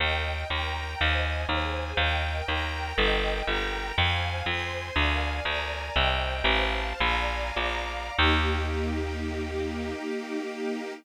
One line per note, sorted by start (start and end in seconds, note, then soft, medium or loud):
0.00 0.44 D#2 medium
0.00 0.48 A#4 medium
0.00 0.48 D#5 medium
0.00 0.48 G5 medium
0.50 0.95 D#2 medium
0.50 1.00 A#4 medium
0.50 1.00 G5 medium
0.50 1.00 A#5 medium
0.98 1.45 D#2 medium
0.98 1.47 C5 medium
0.98 1.47 D#5 medium
0.98 1.47 G#5 medium
1.49 1.93 D#2 medium
1.49 1.98 G#4 medium
1.49 1.98 C5 medium
1.49 1.98 G#5 medium
1.97 2.42 D#2 loud
1.97 2.48 A#4 medium
1.97 2.48 D#5 medium
1.97 2.48 G5 medium
2.48 2.93 D#2 medium
2.48 2.96 A#4 medium
2.48 2.96 G5 medium
2.48 2.98 A#5 medium
2.97 3.42 G1 medium
2.97 3.46 A#4 medium
2.97 3.46 D#5 medium
2.97 3.46 G5 medium
3.47 3.92 G1 medium
3.47 3.96 A#4 medium
3.47 3.96 G5 medium
3.47 3.96 A#5 medium
3.96 4.42 F2 medium
3.96 4.46 C5 medium
3.96 4.46 F5 medium
3.96 4.46 G#5 medium
4.46 4.91 F2 medium
4.46 4.96 C5 medium
4.46 4.94 G#5 medium
4.46 4.96 C6 medium
4.95 5.40 D2 medium
4.95 5.44 A#4 medium
4.95 5.44 D5 medium
4.95 5.44 F5 medium
4.95 5.44 G#5 medium
5.45 5.90 D2 medium
5.45 5.95 A#4 medium
5.45 5.95 D5 medium
5.45 5.95 G#5 medium
5.45 5.95 A#5 medium
5.95 6.42 C2 medium
5.95 6.45 C5 medium
5.95 6.45 D#5 medium
5.95 6.45 G5 medium
6.44 6.93 A1 medium
6.44 6.99 C5 medium
6.44 6.99 F5 medium
6.44 6.99 A5 medium
7.00 7.51 A#1 medium
7.00 7.56 D5 medium
7.00 7.56 F5 medium
7.00 7.57 G#5 medium
7.00 7.56 A#5 medium
7.56 8.10 A#1 medium
7.56 8.16 D5 medium
7.56 8.16 F5 medium
7.56 8.16 A#5 medium
7.56 8.16 D6 medium
8.17 10.93 D#2 loud
8.17 10.92 A#3 medium
8.17 10.92 D#4 medium
8.17 10.92 G4 loud